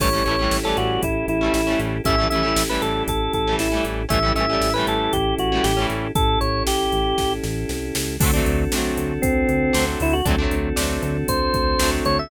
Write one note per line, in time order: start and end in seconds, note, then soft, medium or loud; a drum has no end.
0.00 0.22 A1 loud
0.00 0.09 G3 loud
0.00 0.09 A3 loud
0.00 0.09 C#4 loud
0.00 2.02 C#4 medium
0.00 2.02 E4 medium
0.00 2.02 G4 medium
0.00 2.02 A4 medium
0.00 0.24 C#5 medium
0.00 kick medium
0.00 crash medium
0.04 0.09 E3 medium
0.13 0.23 G3 medium
0.13 0.23 A3 medium
0.13 0.23 C#4 medium
0.18 0.23 E3 medium
0.25 0.48 A1 medium
0.25 0.36 A3 medium
0.25 0.36 C#4 medium
0.25 0.57 C#5 medium
0.25 closed hi-hat soft
0.29 0.36 E3 medium
0.29 0.36 G3 medium
0.39 0.59 G3 loud
0.39 0.59 A3 medium
0.39 0.59 C#4 medium
0.44 0.59 E3 medium
0.51 0.73 A1 medium
0.51 snare medium
0.64 1.05 G3 medium
0.64 1.05 A3 medium
0.64 1.05 C#4 medium
0.64 0.77 A4 medium
0.69 1.05 E3 medium
0.77 0.99 A1 medium
0.77 1.01 F#4 medium
0.77 closed hi-hat medium
1.03 1.24 A1 medium
1.03 1.26 E4 medium
1.03 kick medium
1.03 closed hi-hat medium
1.28 1.50 A1 medium
1.28 1.53 E4 medium
1.28 closed hi-hat medium
1.41 1.62 G3 medium
1.41 1.62 A3 medium
1.41 1.62 C#4 medium
1.46 1.62 E3 medium
1.54 1.76 A1 medium
1.54 1.79 E4 medium
1.54 snare medium
1.67 1.98 G3 medium
1.67 1.98 A3 medium
1.67 1.98 C#4 medium
1.72 1.98 E3 medium
1.79 2.01 A1 medium
1.79 closed hi-hat medium
2.04 2.27 A1 loud
2.04 2.16 A3 medium
2.04 4.05 C#4 medium
2.04 2.16 C#4 loud
2.04 4.05 E4 medium
2.04 4.05 G4 medium
2.04 4.05 A4 medium
2.04 2.27 E5 medium
2.04 kick medium
2.04 closed hi-hat medium
2.09 2.16 E3 medium
2.09 2.16 G3 medium
2.18 2.28 G3 medium
2.18 2.28 A3 medium
2.18 2.28 C#4 medium
2.23 2.28 E3 medium
2.30 2.53 A1 medium
2.30 2.42 A3 medium
2.30 2.42 C#4 medium
2.30 2.63 E5 medium
2.30 closed hi-hat medium
2.35 2.42 E3 medium
2.35 2.42 G3 medium
2.43 2.63 G3 medium
2.43 2.63 A3 medium
2.43 2.63 C#4 medium
2.48 2.63 E3 medium
2.56 2.78 A1 medium
2.56 snare loud
2.69 3.10 G3 medium
2.69 3.10 A3 medium
2.69 3.10 C#4 medium
2.69 2.82 B4 medium
2.74 3.10 E3 medium
2.82 3.04 A1 medium
2.82 3.03 A4 medium
2.82 closed hi-hat medium
3.08 3.29 A1 medium
3.08 3.33 A4 medium
3.08 kick medium
3.08 closed hi-hat medium
3.33 3.55 A1 medium
3.33 3.56 A4 medium
3.33 kick medium
3.33 closed hi-hat medium
3.47 3.68 G3 medium
3.47 3.68 A3 medium
3.47 3.68 C#4 medium
3.52 3.68 E3 medium
3.59 3.81 A1 medium
3.59 3.84 E4 medium
3.59 snare medium
3.72 4.03 G3 medium
3.72 4.03 A3 medium
3.72 4.03 C#4 medium
3.77 4.03 E3 medium
3.85 4.07 A1 medium
3.85 closed hi-hat medium
4.09 4.32 A1 loud
4.09 4.19 G3 loud
4.09 4.19 A3 loud
4.09 4.19 C#4 loud
4.09 6.11 C#4 medium
4.09 6.11 E4 medium
4.09 6.11 G4 medium
4.09 6.11 A4 medium
4.09 4.32 E5 medium
4.09 kick medium
4.09 closed hi-hat medium
4.14 4.19 E3 loud
4.23 4.33 G3 medium
4.23 4.33 A3 medium
4.23 4.33 C#4 medium
4.28 4.33 E3 medium
4.35 4.57 A1 medium
4.35 4.46 G3 medium
4.35 4.46 A3 medium
4.35 4.46 C#4 medium
4.35 4.73 E5 medium
4.35 closed hi-hat medium
4.40 4.46 E3 medium
4.49 4.70 G3 medium
4.49 4.70 A3 medium
4.49 4.70 C#4 medium
4.54 4.70 E3 medium
4.61 4.83 A1 medium
4.61 snare medium
4.74 5.17 A3 medium
4.74 5.17 C#4 medium
4.74 4.86 B4 medium
4.79 5.17 E3 medium
4.79 5.17 G3 medium
4.87 5.09 A1 medium
4.87 5.13 A4 medium
4.87 closed hi-hat medium
5.13 5.35 A1 medium
5.13 5.35 G4 medium
5.13 kick medium
5.13 closed hi-hat medium
5.38 5.60 A1 medium
5.38 5.64 F#4 medium
5.38 closed hi-hat medium
5.52 5.73 G3 medium
5.52 5.73 A3 medium
5.52 5.73 C#4 medium
5.57 5.73 E3 medium
5.64 5.86 A1 medium
5.64 5.86 G4 medium
5.64 snare medium
5.77 6.07 G3 medium
5.77 6.07 A3 medium
5.77 6.07 C#4 medium
5.82 6.07 E3 loud
5.90 6.11 A1 medium
5.90 closed hi-hat medium
6.15 6.37 A1 medium
6.15 8.16 C#4 medium
6.15 8.16 E4 medium
6.15 8.16 G4 medium
6.15 8.16 A4 medium
6.15 6.39 A4 medium
6.15 kick medium
6.15 closed hi-hat medium
6.41 6.63 A1 medium
6.41 6.63 C#5 medium
6.41 closed hi-hat medium
6.67 6.89 A1 medium
6.67 7.33 G4 medium
6.67 snare medium
6.92 7.14 A1 medium
6.92 closed hi-hat medium
7.18 7.40 A1 medium
7.18 kick medium
7.18 snare medium
7.43 7.65 A1 loud
7.43 snare medium
7.69 7.92 C2 medium
7.69 snare medium
7.95 8.18 C#2 medium
7.95 snare loud
8.20 8.42 D2 loud
8.20 10.21 C4 medium
8.20 8.31 C4 medium
8.20 10.21 D4 medium
8.20 8.31 D4 loud
8.20 10.21 F#4 medium
8.20 10.21 A4 medium
8.20 kick medium
8.20 crash loud
8.24 8.31 F#3 loud
8.24 8.31 A3 loud
8.34 8.64 A3 medium
8.34 8.64 C4 medium
8.34 8.64 D4 loud
8.39 8.64 F#3 medium
8.46 8.68 D2 loud
8.46 closed hi-hat medium
8.72 8.93 D2 medium
8.72 9.13 C4 medium
8.72 9.13 D4 medium
8.72 snare medium
8.76 9.13 F#3 medium
8.76 9.13 A3 loud
8.97 9.19 D2 medium
8.97 closed hi-hat medium
9.22 9.45 D2 medium
9.22 9.85 C4 medium
9.22 kick medium
9.22 closed hi-hat medium
9.49 9.71 D2 medium
9.49 closed hi-hat medium
9.73 9.96 D2 medium
9.73 10.14 A3 loud
9.73 10.14 C4 loud
9.73 10.14 D4 medium
9.73 snare medium
9.78 10.14 F#3 medium
10.00 10.22 D2 loud
10.00 10.14 E4 medium
10.00 open hi-hat medium
10.13 10.25 F#4 medium
10.25 10.48 D2 loud
10.25 10.36 A3 loud
10.25 12.27 C4 medium
10.25 10.36 C4 loud
10.25 10.36 D4 loud
10.25 12.27 D4 medium
10.25 12.27 F#4 medium
10.25 12.27 A4 medium
10.25 kick medium
10.25 closed hi-hat medium
10.30 10.36 F#3 loud
10.38 10.69 A3 medium
10.38 10.69 C4 medium
10.38 10.69 D4 loud
10.43 10.69 F#3 medium
10.51 10.73 D2 loud
10.51 closed hi-hat medium
10.76 10.99 D2 medium
10.76 11.17 A3 medium
10.76 11.17 C4 medium
10.76 11.17 D4 loud
10.76 snare medium
10.81 11.17 F#3 medium
11.02 11.24 D2 loud
11.02 closed hi-hat medium
11.28 11.50 D2 medium
11.28 11.90 C5 medium
11.28 kick medium
11.28 closed hi-hat medium
11.54 11.76 D2 medium
11.54 kick medium
11.54 closed hi-hat medium
11.79 12.01 D2 medium
11.79 12.20 A3 loud
11.79 12.20 C4 medium
11.79 12.20 D4 medium
11.79 snare loud
11.84 12.20 F#3 medium
12.05 12.27 D2 medium
12.05 12.18 C#5 medium
12.05 closed hi-hat medium
12.19 12.30 E5 medium